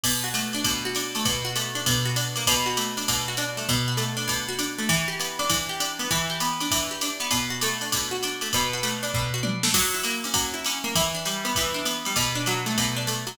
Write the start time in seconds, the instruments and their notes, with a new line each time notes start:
0.04 acoustic guitar (steel) B2, kick, crash, ride
0.24 acoustic guitar (steel) F#4
0.34 acoustic guitar (steel) A3, hi-hat pedal, ride
0.53 acoustic guitar (steel) D4, ride
0.64 acoustic guitar (steel) B2, kick, ride
0.85 acoustic guitar (steel) F#4
0.95 acoustic guitar (steel) D4, hi-hat pedal, ride
1.15 acoustic guitar (steel) A3, ride
1.25 acoustic guitar (steel) B2, kick, ride
1.45 acoustic guitar (steel) F#4
1.56 acoustic guitar (steel) A3, hi-hat pedal, ride
1.75 acoustic guitar (steel) D4, ride
1.86 acoustic guitar (steel) B2, kick, ride
2.05 acoustic guitar (steel) F#4
2.16 acoustic guitar (steel) D4, hi-hat pedal, ride
2.36 acoustic guitar (steel) A#3, ride
2.46 acoustic guitar (steel) B2, kick, ride
2.66 acoustic guitar (steel) F#4
2.77 acoustic guitar (steel) A3, hi-hat pedal, ride
2.97 acoustic guitar (steel) D4, ride
3.08 acoustic guitar (steel) B2, kick, ride
3.28 acoustic guitar (steel) F#4
3.37 acoustic guitar (steel) D4, hi-hat pedal, ride
3.57 acoustic guitar (steel) A3, ride
3.69 acoustic guitar (steel) B2, kick, ride
3.88 acoustic guitar (steel) F#4
3.97 acoustic guitar (steel) A3, hi-hat pedal, ride
4.17 acoustic guitar (steel) D4, ride
4.28 acoustic guitar (steel) B2, kick, ride
4.49 acoustic guitar (steel) F#4
4.59 acoustic guitar (steel) D4, hi-hat pedal, ride
4.78 acoustic guitar (steel) A3, ride
4.89 acoustic guitar (steel) E3, kick, ride
5.08 acoustic guitar (steel) G4
5.20 acoustic guitar (steel) B3, hi-hat pedal, ride
5.39 acoustic guitar (steel) D4, ride
5.50 acoustic guitar (steel) E3, kick, ride
5.69 acoustic guitar (steel) G4
5.80 acoustic guitar (steel) D4, hi-hat pedal, ride
5.99 acoustic guitar (steel) B3, ride
6.11 acoustic guitar (steel) E3, kick, ride
6.30 acoustic guitar (steel) G4
6.40 acoustic guitar (steel) B3, hi-hat pedal, ride
6.60 acoustic guitar (steel) D4, ride
6.71 acoustic guitar (steel) E3, kick, ride
6.91 acoustic guitar (steel) G4
7.01 acoustic guitar (steel) D4, hi-hat pedal, ride
7.20 acoustic guitar (steel) B3, ride
7.31 acoustic guitar (steel) B2, kick, ride
7.50 acoustic guitar (steel) F#4
7.61 acoustic guitar (steel) A3, hi-hat pedal, ride
7.81 acoustic guitar (steel) D4, ride
7.92 acoustic guitar (steel) B2, kick, ride
8.11 acoustic guitar (steel) F#4
8.23 acoustic guitar (steel) D4, hi-hat pedal, ride
8.41 acoustic guitar (steel) A3, ride
8.53 acoustic guitar (steel) B2, kick, ride
8.73 acoustic guitar (steel) F#4
8.83 acoustic guitar (steel) A3, hi-hat pedal, ride
9.03 acoustic guitar (steel) D4, ride
9.14 acoustic guitar (steel) B2, kick
9.34 acoustic guitar (steel) F#4
9.43 acoustic guitar (steel) D4, high tom
9.63 acoustic guitar (steel) A3, snare
9.74 acoustic guitar (steel) F#3, kick, crash, ride
9.94 acoustic guitar (steel) E4
10.03 acoustic guitar (steel) A#3, hi-hat pedal, ride
10.24 acoustic guitar (steel) C#4, ride
10.34 acoustic guitar (steel) F#3, kick, ride
10.54 acoustic guitar (steel) E4
10.65 acoustic guitar (steel) C#4, hi-hat pedal, ride
10.84 acoustic guitar (steel) A#3, ride
10.95 acoustic guitar (steel) E3, kick, ride
11.15 acoustic guitar (steel) D4
11.25 acoustic guitar (steel) G3, hi-hat pedal, ride
11.45 acoustic guitar (steel) B3, ride
11.55 acoustic guitar (steel) E3, kick, ride
11.74 acoustic guitar (steel) D4
11.85 acoustic guitar (steel) B3, hi-hat pedal, ride
12.05 acoustic guitar (steel) G3, ride
12.16 acoustic guitar (steel) B2, kick, ride
12.35 acoustic guitar (steel) D4
12.46 acoustic guitar (steel) F#3, hi-hat pedal, ride
12.66 acoustic guitar (steel) A3, ride
12.77 acoustic guitar (steel) B2, kick, ride
12.96 acoustic guitar (steel) D4
13.07 acoustic guitar (steel) A3, hi-hat pedal, ride
13.27 acoustic guitar (steel) F#3, ride